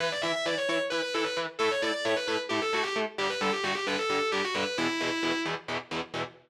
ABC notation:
X:1
M:7/8
L:1/16
Q:1/4=132
K:Edor
V:1 name="Distortion Guitar"
B d e e d c c z B B A B z2 | A c d d c B B z G A F G z2 | G B A G F G B A3 G F B2 | E6 z8 |]
V:2 name="Overdriven Guitar"
[E,EB]2 [E,EB]2 [E,EB]2 [E,EB]2 [E,EB]2 [E,EB]2 [E,EB]2 | [A,EA]2 [A,EA]2 [A,EA]2 [A,EA]2 [A,EA]2 [A,EA]2 [A,EA]2 | [G,,D,G,]2 [G,,D,G,]2 [G,,D,G,]2 [G,,D,G,]2 [G,,D,G,]2 [G,,D,G,]2 [G,,D,G,]2 | [E,,B,,E,]2 [E,,B,,E,]2 [E,,B,,E,]2 [E,,B,,E,]2 [E,,B,,E,]2 [E,,B,,E,]2 [E,,B,,E,]2 |]